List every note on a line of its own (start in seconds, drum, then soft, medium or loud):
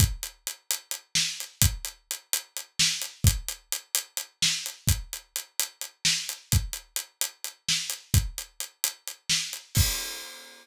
0.00 kick loud
0.00 closed hi-hat loud
0.23 closed hi-hat medium
0.47 closed hi-hat medium
0.71 closed hi-hat loud
0.91 closed hi-hat medium
1.15 snare loud
1.40 closed hi-hat medium
1.62 kick loud
1.62 closed hi-hat loud
1.85 closed hi-hat medium
2.11 closed hi-hat medium
2.33 closed hi-hat loud
2.57 closed hi-hat medium
2.79 snare loud
3.02 closed hi-hat medium
3.24 kick loud
3.24 closed hi-hat loud
3.48 closed hi-hat medium
3.72 closed hi-hat loud
3.95 closed hi-hat loud
4.17 closed hi-hat medium
4.42 snare loud
4.66 closed hi-hat medium
4.87 kick loud
4.87 closed hi-hat loud
5.13 closed hi-hat medium
5.36 closed hi-hat medium
5.59 closed hi-hat loud
5.81 closed hi-hat medium
6.05 snare loud
6.29 closed hi-hat medium
6.52 kick loud
6.52 closed hi-hat loud
6.73 closed hi-hat medium
6.96 closed hi-hat loud
7.21 closed hi-hat loud
7.44 closed hi-hat medium
7.69 snare loud
7.90 closed hi-hat medium
8.14 kick loud
8.14 closed hi-hat loud
8.38 closed hi-hat medium
8.60 closed hi-hat medium
8.84 closed hi-hat loud
9.07 closed hi-hat medium
9.29 snare loud
9.53 closed hi-hat medium
9.75 kick loud
9.75 crash loud